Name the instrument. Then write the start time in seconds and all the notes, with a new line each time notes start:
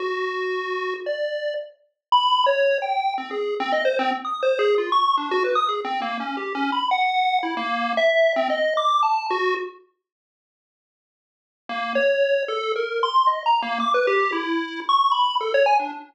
lead 1 (square)
0.00 F#4
1.06 D5
2.12 B5
2.46 C#5
2.82 G5
3.18 C4
3.31 G#4
3.60 C4
3.72 D#5
3.85 C5
3.99 C4
4.25 D#6
4.43 C5
4.59 G#4
4.78 F4
4.92 C#6
5.17 D4
5.31 F#4
5.44 B4
5.55 D#6
5.69 G#4
5.85 C4
6.02 A#3
6.20 C#4
6.37 G4
6.55 C#4
6.72 B5
6.91 F#5
7.43 E4
7.57 A#3
7.97 E5
8.36 C4
8.50 D#5
8.77 D6
9.03 A5
9.31 F#4
11.69 A#3
11.95 C#5
12.48 A4
12.76 A#4
13.03 C6
13.27 D#5
13.46 A#5
13.62 A#3
13.80 D6
13.94 B4
14.07 G4
14.32 E4
14.89 C#6
15.12 B5
15.41 A4
15.54 C#5
15.66 G#5
15.80 D4